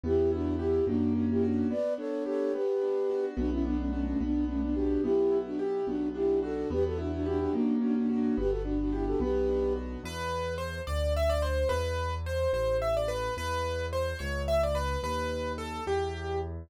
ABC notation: X:1
M:6/8
L:1/16
Q:3/8=72
K:Bm
V:1 name="Flute"
[EG]2 [DF]2 [EG]2 [DF]2 [DF] [EG] [DF]2 | [Bd]2 [Ac]2 [Ac]2 [GB]6 | [DF] [CE] [B,D] [A,C] [A,C] [A,C] [B,D]2 [A,C] [B,D] [DF]2 | [EG]3 [DF] z2 [DF]2 [EG]2 [FA]2 |
[GB] [FA] [DF] [DF] [DF] [DF] [DF]2 [DF] [DF] [DF]2 | [GB] [FA] [DF] [DF] [EG] [FA] [GB]4 z2 | [K:Em] z12 | z12 |
z12 | z12 |]
V:2 name="Acoustic Grand Piano"
z12 | z12 | z12 | z12 |
z12 | z12 | [K:Em] B4 c2 d2 e d c2 | B4 c2 c2 e d B2 |
B4 c2 ^c2 e d B2 | B4 A2 G4 z2 |]
V:3 name="Acoustic Grand Piano"
B,2 E2 G2 ^A,2 C2 F2 | B,2 D2 G2 B,2 D2 F2 | B,2 D2 F2 B,2 D2 G2 | B,2 E2 G2 B,2 D2 F2 |
B,2 E2 G2 ^A,2 C2 F2 | B,2 D2 G2 B,2 D2 F2 | [K:Em] z12 | z12 |
z12 | z12 |]
V:4 name="Acoustic Grand Piano" clef=bass
E,,6 F,,6 | z12 | B,,,6 B,,,6 | B,,,6 B,,,6 |
E,,6 F,,6 | G,,,6 B,,,6 | [K:Em] E,,6 D,,6 | E,,6 A,,,6 |
E,,6 ^C,,6 | ^D,,6 E,,6 |]